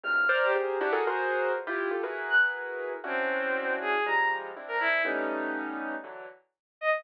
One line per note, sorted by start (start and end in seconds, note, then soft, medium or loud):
0.03 0.26 E2 medium
0.03 0.26 F#2 medium
0.03 0.26 G#2 medium
0.03 0.26 A#2 medium
0.03 0.26 C3 medium
0.03 0.26 C#3 medium
0.03 0.37 F6 medium
0.29 0.51 A#4 loud
0.29 0.51 C5 loud
0.29 0.51 D5 loud
0.43 0.55 G4 medium
0.55 0.78 G4 medium
0.55 0.78 G#4 medium
0.55 0.78 A#4 medium
0.55 0.78 C5 medium
0.81 0.92 D4 loud
0.81 0.92 E4 loud
0.81 0.92 F#4 loud
0.81 0.92 G4 loud
0.92 1.04 F#4 loud
0.92 1.04 G#4 loud
0.92 1.04 A4 loud
0.92 1.04 A#4 loud
1.07 1.52 F#4 medium
1.07 1.52 G#4 medium
1.07 1.52 A#4 medium
1.07 1.52 C5 medium
1.54 1.65 E2 medium
1.54 1.65 F2 medium
1.54 1.65 G2 medium
1.67 1.89 E4 medium
1.67 1.89 F4 medium
1.67 1.89 G4 medium
1.91 2.02 F4 medium
1.91 2.02 G4 medium
1.91 2.02 A4 medium
2.03 2.93 E4 medium
2.03 2.93 F#4 medium
2.03 2.93 G#4 medium
2.03 2.93 A#4 medium
2.03 2.93 B4 medium
2.30 2.41 F#6 medium
3.04 3.74 C4 medium
3.04 3.94 C#4 medium
3.04 3.94 D4 medium
3.04 3.94 E4 medium
3.04 3.94 F#4 medium
3.81 4.04 G#4 medium
4.06 4.51 F3 medium
4.06 4.51 G3 medium
4.06 4.51 G#3 medium
4.06 4.28 A#5 medium
4.56 5.01 C4 medium
4.56 5.01 D4 medium
4.56 5.01 E4 medium
4.68 4.79 A#4 medium
4.80 5.03 E4 medium
5.05 5.95 G3 medium
5.05 5.95 A3 medium
5.05 5.95 B3 medium
5.05 5.95 C#4 medium
5.05 5.95 D#4 medium
6.04 6.26 D3 medium
6.04 6.26 E3 medium
6.04 6.26 F#3 medium
6.81 7.03 D#5 medium